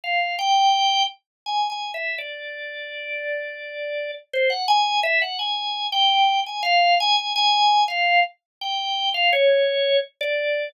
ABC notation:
X:1
M:3/4
L:1/16
Q:1/4=84
K:none
V:1 name="Drawbar Organ"
f2 g4 z2 (3^g2 g2 e2 | d12 | c ^f ^g2 e f g3 =g3 | ^g f2 g g g3 f2 z2 |
g3 f ^c4 z d3 |]